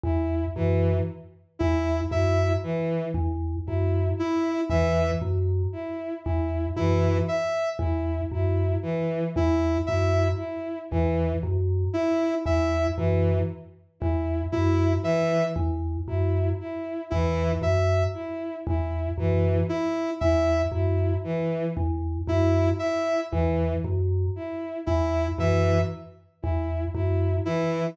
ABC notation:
X:1
M:9/8
L:1/8
Q:3/8=39
K:none
V:1 name="Vibraphone" clef=bass
E,, _G,, z E,, G,, z E,, G,, z | E,, _G,, z E,, G,, z E,, G,, z | E,, _G,, z E,, G,, z E,, G,, z | E,, _G,, z E,, G,, z E,, G,, z |
E,, _G,, z E,, G,, z E,, G,, z | E,, _G,, z E,, G,, z E,, G,, z |]
V:2 name="Violin"
E E, z E E E, z E E | E, z E E E, z E E E, | z E E E, z E E E, z | E E E, z E E E, z E |
E E, z E E E, z E E | E, z E E E, z E E E, |]
V:3 name="Ocarina"
z3 E e z3 E | e z3 E e z3 | E e z3 E e z2 | z E e z3 E e z |
z2 E e z3 E e | z3 E e z3 E |]